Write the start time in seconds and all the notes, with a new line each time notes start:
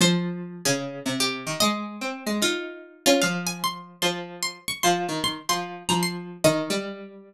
0.00 F3 C5
0.65 C#3 G#4
1.05 C3
1.20 G4
1.46 D#3
1.60 G#3 D#5
2.01 C4
2.26 G#3
2.42 D#4 F4
3.06 C#4 F4
3.22 F3 F5
3.47 G#5
3.64 C6
4.02 F3 C6
4.43 C6
4.68 C#6
4.83 F3 C6
5.08 D#3
5.24 C6
5.49 F3 C6
5.89 F3 A#5
6.03 C6
6.44 D#3 D#5
6.70 G3